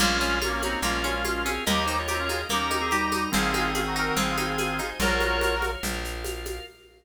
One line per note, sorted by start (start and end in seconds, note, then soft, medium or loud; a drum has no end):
0.00 0.76 A#1 medium
0.00 0.39 G#3 medium
0.00 0.18 A#3 medium
0.00 0.39 C#4 loud
0.00 0.39 F4 medium
0.00 0.39 F4 loud
0.00 0.82 A#4 medium
0.00 0.82 C#5 medium
0.00 0.82 F5 medium
0.00 crash loud
0.00 low conga loud
0.00 shaker medium
0.21 0.40 C#4 medium
0.21 shaker medium
0.42 0.52 A#3 medium
0.42 0.52 C#4 loud
0.42 0.60 F4 medium
0.42 high conga loud
0.42 shaker medium
0.52 0.62 A#3 medium
0.52 0.62 C#4 loud
0.61 0.79 A#3 medium
0.61 0.81 C4 medium
0.61 0.82 C#4 medium
0.61 0.81 D#4 loud
0.61 0.79 F#4 medium
0.61 high conga medium
0.61 shaker medium
0.82 1.59 A#1 medium
0.82 1.04 G#3 medium
0.82 1.02 A#3 medium
0.82 1.52 C#4 medium
0.82 1.52 F4 loud
0.82 1.67 F4 medium
0.82 1.04 F4 medium
0.82 1.66 A#4 medium
0.82 1.67 F5 loud
0.82 low conga medium
0.82 shaker medium
1.04 1.23 G#3 medium
1.04 1.23 C#4 medium
1.04 1.23 F4 medium
1.04 high conga medium
1.04 shaker medium
1.24 1.43 G#3 medium
1.24 1.43 F4 medium
1.24 1.44 F4 medium
1.24 high conga medium
1.24 shaker medium
1.45 1.64 C4 medium
1.45 1.64 C#4 medium
1.45 1.64 G#4 medium
1.45 high conga medium
1.45 shaker medium
1.66 2.44 D#2 medium
1.66 1.86 A#3 medium
1.66 2.02 D#4 loud
1.66 1.83 G4 medium
1.66 2.02 G4 loud
1.66 2.49 A#4 medium
1.66 1.83 D#5 medium
1.66 2.49 D#5 medium
1.66 2.49 G5 loud
1.66 low conga loud
1.66 shaker medium
1.86 1.96 D#4 medium
1.86 2.06 D#4 medium
1.86 1.96 C5 medium
1.86 shaker medium
1.99 2.41 F4 medium
1.99 2.41 C#5 medium
2.08 2.19 C4 medium
2.08 2.19 D#4 medium
2.08 2.27 G4 medium
2.08 high conga medium
2.08 shaker medium
2.19 2.29 C#4 medium
2.19 2.29 F4 loud
2.29 2.48 D#4 medium
2.29 2.46 F4 medium
2.29 2.46 G#4 loud
2.29 high conga medium
2.29 shaker medium
2.49 3.27 D#2 medium
2.49 2.69 A#3 medium
2.49 2.82 C#4 medium
2.49 3.24 D#4 medium
2.49 3.24 G4 loud
2.49 3.32 A#4 medium
2.49 2.82 A#4 medium
2.49 3.32 G5 medium
2.49 3.32 A#5 loud
2.49 low conga medium
2.49 shaker medium
2.70 2.89 D#4 medium
2.70 high conga medium
2.70 shaker medium
2.81 2.91 C4 medium
2.81 2.91 G#4 medium
2.91 3.30 G3 medium
2.91 3.30 D#4 medium
2.91 3.11 G4 medium
2.91 high conga medium
2.91 shaker medium
3.12 3.31 D#4 medium
3.12 high conga medium
3.12 shaker medium
3.32 4.11 G#1 medium
3.32 4.80 D#3 medium
3.32 4.80 C4 medium
3.32 3.52 C4 medium
3.32 3.71 F4 loud
3.32 3.71 G#4 loud
3.32 4.16 C5 medium
3.32 4.16 D#5 medium
3.32 4.16 G#5 medium
3.32 low conga loud
3.32 shaker medium
3.54 3.73 D#4 medium
3.54 high conga medium
3.54 shaker medium
3.74 3.84 C#4 medium
3.74 3.84 F4 medium
3.74 3.94 G#4 medium
3.74 high conga medium
3.74 shaker medium
3.86 3.96 D#4 medium
3.86 3.96 F#4 loud
3.96 4.15 D#4 medium
3.96 4.16 F#4 loud
3.96 4.16 A#4 loud
3.96 shaker medium
4.16 4.93 G#1 medium
4.16 4.36 C4 medium
4.16 4.90 F4 medium
4.16 4.99 G#4 medium
4.16 4.90 G#4 loud
4.16 4.99 C5 loud
4.16 4.99 G#5 medium
4.16 low conga loud
4.16 shaker medium
4.37 4.56 D#4 medium
4.37 high conga medium
4.37 shaker medium
4.58 4.78 G#4 medium
4.58 high conga medium
4.58 shaker medium
4.79 4.98 D#4 medium
4.79 high conga medium
4.79 shaker medium
5.00 5.76 A#1 medium
5.00 5.55 F4 medium
5.00 5.70 F#4 loud
5.00 5.70 A#4 loud
5.00 5.83 A#4 medium
5.00 5.83 C#5 medium
5.00 5.55 C#5 medium
5.00 5.83 F5 medium
5.00 low conga loud
5.00 shaker medium
5.20 high conga medium
5.20 shaker medium
5.41 high conga loud
5.41 shaker medium
5.62 high conga medium
5.62 shaker medium
5.83 6.60 A#1 medium
5.83 6.66 F4 loud
5.83 6.66 A#4 medium
5.83 6.66 F5 medium
5.83 low conga medium
5.83 shaker loud
6.04 shaker medium
6.24 high conga medium
6.24 shaker medium
6.45 high conga medium
6.45 shaker medium